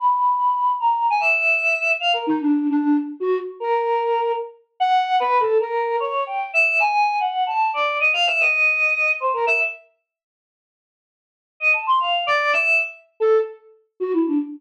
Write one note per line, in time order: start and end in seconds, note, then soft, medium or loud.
0.00 0.72 B5 medium
0.80 1.07 A#5 medium
1.10 1.19 G#5 loud
1.20 1.92 E5 medium
2.00 2.12 F5 medium
2.13 2.25 A#4 medium
2.27 2.39 D#4 loud
2.40 2.67 D4 medium
2.70 2.97 D4 loud
3.20 3.38 F#4 loud
3.60 4.32 A#4 medium
4.80 5.16 F#5 loud
5.20 5.38 B4 loud
5.40 5.58 A4 medium
5.60 5.96 A#4 medium
6.00 6.24 C#5 medium
6.27 6.51 G5 medium
6.53 6.77 E5 medium
6.80 7.16 G#5 loud
7.20 7.44 F#5 medium
7.47 7.71 A5 medium
7.74 7.98 D5 medium
8.00 8.12 D#5 medium
8.13 8.25 F5 loud
8.27 8.39 E5 loud
8.40 9.12 D#5 medium
9.20 9.32 C5 medium
9.33 9.45 A#4 medium
9.47 9.59 E5 medium
11.60 11.72 D#5 medium
11.73 11.85 A5 medium
11.87 11.99 C6 medium
12.00 12.24 F5 medium
12.27 12.51 D5 loud
12.53 12.77 E5 loud
13.20 13.38 A4 loud
14.00 14.12 F#4 medium
14.13 14.25 E4 medium
14.27 14.39 D4 medium